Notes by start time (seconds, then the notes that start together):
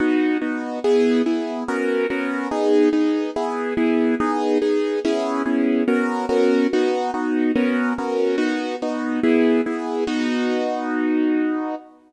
0.00 B3 D#4 F#4
0.41 B3 D#4 F#4
0.84 B3 E4 G#4
1.26 B3 E4 G#4
1.68 B3 C#4 F#4 A#4
2.10 B3 C#4 F#4 A#4
2.51 B3 D#4 G#4
2.93 B3 D#4 G#4
3.36 B3 E4 G#4
3.77 B3 E4 G#4
4.20 B3 D#4 G#4
4.61 B3 D#4 G#4
5.04 B3 C#4 E4 G#4
5.45 B3 C#4 E4 G#4
5.88 B3 C#4 F#4 A#4
6.29 B3 C#4 F#4 A#4
6.73 B3 D#4 F#4
7.14 B3 D#4 F#4
7.55 B3 C#4 F#4 A#4
7.98 B3 C#4 F#4 A#4
8.38 B3 D#4 F#4
8.82 B3 D#4 F#4
9.23 B3 E4 G#4
9.66 B3 E4 G#4
10.07 B3 D#4 F#4